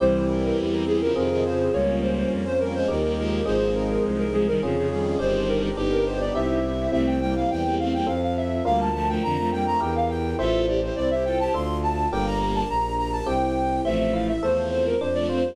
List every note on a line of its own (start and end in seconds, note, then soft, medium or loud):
0.00 0.52 C2 loud
0.00 0.84 E3 loud
0.00 0.84 G3 loud
0.00 1.12 C4 medium
0.00 1.13 C4 medium
0.00 1.12 E4 loud
0.00 1.13 E4 medium
0.00 1.12 G4 medium
0.00 1.13 G4 medium
0.00 0.23 C5 loud
0.29 0.42 A#4 medium
0.43 0.57 A#4 loud
0.58 1.10 E2 medium
0.72 0.86 A#4 loud
0.87 1.00 E3 medium
0.87 1.00 G3 loud
0.87 1.00 G#4 loud
1.01 1.15 C#3 loud
1.01 1.15 F3 loud
1.01 1.15 A#4 loud
1.15 1.69 F2 medium
1.15 1.29 C3 medium
1.15 1.29 D#3 loud
1.15 1.72 C4 medium
1.15 1.73 C4 loud
1.15 1.72 F4 medium
1.15 1.73 F4 medium
1.15 1.72 G#4 medium
1.15 1.73 G#4 loud
1.15 1.43 A#4 loud
1.30 1.44 C3 loud
1.30 1.44 D#3 loud
1.44 1.69 C#3 medium
1.44 1.69 F3 loud
1.44 1.72 C5 loud
1.73 2.25 C#2 medium
1.73 2.45 G3 loud
1.73 2.45 A#3 loud
1.73 2.88 A#3 medium
1.73 2.87 A#3 medium
1.73 2.88 C#4 loud
1.73 2.87 C#4 medium
1.73 2.88 F4 medium
1.73 2.87 F4 medium
1.73 1.98 C#5 loud
2.02 2.16 C5 medium
2.16 2.30 C5 medium
2.31 2.83 F2 medium
2.45 2.59 C5 loud
2.60 2.73 G3 medium
2.60 2.73 A#3 loud
2.60 2.73 A#4 loud
2.74 2.88 F3 loud
2.74 2.88 G#3 loud
2.74 2.88 C5 loud
2.88 3.41 D#2 medium
2.88 3.02 D#3 medium
2.88 3.02 G3 medium
2.88 3.45 A#3 medium
2.88 3.47 A#3 medium
2.88 3.45 D#4 medium
2.88 3.44 D#4 medium
2.88 3.45 G4 medium
2.88 3.47 G4 medium
2.88 3.12 A#4 medium
3.03 3.16 D#3 medium
3.03 3.16 G3 medium
3.17 3.41 F3 medium
3.17 3.41 G#3 loud
3.17 3.44 A#4 loud
3.44 3.98 G#1 medium
3.44 4.25 F3 loud
3.44 4.25 G#3 loud
3.44 4.58 C4 medium
3.44 4.59 C4 medium
3.44 4.58 D#4 medium
3.44 4.59 D#4 medium
3.44 4.58 G#4 medium
3.44 4.59 G#4 medium
3.44 3.70 C5 loud
3.75 3.89 A#4 loud
3.90 4.03 A#4 loud
4.04 4.56 C2 medium
4.18 4.32 A#4 loud
4.33 4.46 F3 loud
4.33 4.46 G#3 loud
4.33 4.46 G#4 loud
4.47 4.61 D#3 medium
4.47 4.61 G3 loud
4.47 4.61 A#4 loud
4.62 5.15 F2 medium
4.62 4.75 C#3 medium
4.62 4.75 F3 loud
4.62 5.20 C#4 medium
4.62 5.19 C#4 medium
4.62 5.20 F4 medium
4.62 5.19 F4 medium
4.62 4.88 G#4 loud
4.62 5.20 G#4 medium
4.62 5.19 G#4 medium
4.76 4.90 C#3 loud
4.76 4.90 F3 loud
4.90 5.17 D#3 medium
4.90 5.17 G3 loud
4.90 5.17 G#4 loud
5.19 5.72 G1 medium
5.19 5.69 D#3 loud
5.19 5.69 G3 loud
5.19 5.75 C4 medium
5.19 5.77 C4 loud
5.19 5.75 D4 medium
5.19 5.76 D4 medium
5.19 5.75 G4 medium
5.19 5.76 G4 medium
5.19 5.47 C5 loud
5.48 5.62 A#4 loud
5.62 5.76 A#4 loud
5.77 6.30 G1 medium
5.77 6.34 B3 medium
5.77 6.34 D4 medium
5.77 6.59 D#4 loud
5.77 6.34 G4 loud
5.77 6.59 G4 loud
5.77 6.34 G4 medium
5.92 6.05 A#4 loud
6.06 6.20 C5 loud
6.20 6.34 D5 loud
6.35 6.88 C2 medium
6.35 6.92 C4 medium
6.35 6.91 C4 medium
6.35 6.92 E4 medium
6.35 6.91 E4 medium
6.35 6.92 G4 medium
6.35 6.91 G4 medium
6.35 6.90 E5 loud
6.92 7.44 C2 medium
6.92 7.19 A3 loud
6.92 7.19 C4 loud
6.92 8.05 C4 medium
6.92 8.05 E4 medium
6.92 8.05 G4 medium
6.92 7.06 E5 loud
7.07 7.20 G5 loud
7.21 7.35 G3 medium
7.21 7.35 A#3 loud
7.21 7.35 G5 loud
7.35 7.49 G3 medium
7.35 7.49 A#3 loud
7.35 7.50 F5 loud
7.50 8.02 E2 medium
7.50 7.63 E3 medium
7.50 7.63 G3 medium
7.50 7.74 G5 loud
7.65 7.78 G3 medium
7.65 7.78 A#3 loud
7.79 7.93 A3 medium
7.79 7.93 C4 loud
7.79 7.93 F5 medium
7.94 8.07 G3 medium
7.94 8.07 A#3 medium
7.94 8.07 G5 medium
8.06 8.61 F2 medium
8.06 8.63 C4 medium
8.06 8.63 F4 medium
8.06 8.63 A4 medium
8.06 8.21 F5 loud
8.22 8.36 F5 medium
8.37 8.64 E5 medium
8.65 9.17 D2 medium
8.65 8.89 G3 loud
8.65 8.89 A#3 loud
8.65 9.78 D4 medium
8.65 9.78 F4 medium
8.65 9.78 A#4 medium
8.65 8.79 F5 loud
8.80 8.94 A5 loud
8.94 9.08 F3 medium
8.94 9.08 A3 loud
8.94 9.08 A5 loud
9.08 9.22 F3 loud
9.08 9.22 A3 loud
9.08 9.22 G5 loud
9.23 9.75 F2 medium
9.23 9.37 D3 loud
9.23 9.37 F3 loud
9.23 9.49 A#5 loud
9.38 9.51 F3 loud
9.38 9.51 A3 loud
9.52 9.66 G3 medium
9.52 9.66 A#3 loud
9.52 9.66 G5 loud
9.66 9.80 F3 medium
9.66 9.80 A3 loud
9.66 9.80 A#5 loud
9.80 10.34 E2 medium
9.80 10.37 E4 medium
9.80 10.37 G4 medium
9.80 10.37 A#4 medium
9.80 9.94 G5 loud
9.95 10.09 F5 loud
10.09 10.36 G5 loud
10.38 10.90 A1 medium
10.38 11.52 E4 medium
10.38 10.66 F4 loud
10.38 10.66 A4 loud
10.38 11.52 A4 medium
10.38 11.52 C5 medium
10.38 10.64 E5 loud
10.67 10.81 E4 medium
10.67 10.81 G4 loud
10.67 10.81 D5 medium
10.81 10.95 E4 medium
10.81 10.95 G4 medium
10.81 10.96 C5 medium
10.96 11.48 C2 medium
10.96 11.10 C4 loud
10.96 11.10 E4 loud
10.96 11.10 D5 loud
11.10 11.24 E4 medium
11.10 11.24 G4 loud
11.10 11.24 E5 loud
11.25 11.39 F4 medium
11.25 11.39 A4 loud
11.25 11.39 G5 loud
11.39 11.53 E4 medium
11.39 11.53 G4 loud
11.39 11.53 A5 loud
11.54 12.07 D2 medium
11.54 12.10 D4 medium
11.54 12.10 F4 medium
11.54 12.10 A4 medium
11.54 11.78 C6 loud
11.83 12.08 A5 loud
12.11 12.63 G1 medium
12.11 12.63 G3 loud
12.11 12.63 A#3 loud
12.11 13.26 D4 medium
12.11 13.26 G4 medium
12.11 13.26 A#4 medium
12.11 12.25 G5 loud
12.26 12.40 A#5 loud
12.41 12.54 A#5 medium
12.55 12.68 A5 loud
12.69 13.21 A#1 medium
12.69 12.94 A#5 loud
12.98 13.12 A#5 medium
13.12 13.26 A5 loud
13.26 13.80 C2 medium
13.26 13.83 C4 medium
13.26 13.83 E4 medium
13.26 13.83 G4 medium
13.26 13.81 G5 loud
13.85 14.37 A1 medium
13.85 14.32 F3 loud
13.85 14.32 A3 loud
13.85 14.11 C4 loud
13.85 13.98 E5 loud
13.99 14.12 E5 loud
14.13 14.39 E4 medium
14.13 14.27 F5 loud
14.28 14.42 E5 loud
14.42 14.94 E2 medium
14.42 14.95 F3 medium
14.42 14.95 A3 loud
14.42 14.69 A4 medium
14.42 14.69 C5 loud
14.70 14.96 C4 medium
14.70 14.85 C5 loud
14.86 14.99 A#4 loud
15.00 15.53 F2 medium
15.00 15.27 D4 loud
15.00 15.14 C5 loud
15.14 15.28 F3 medium
15.14 15.28 A3 loud
15.14 15.28 D5 loud
15.29 15.43 A3 medium
15.29 15.43 C4 loud
15.29 15.55 F4 medium
15.29 15.56 C5 loud
15.44 15.56 G3 medium
15.44 15.56 A#3 medium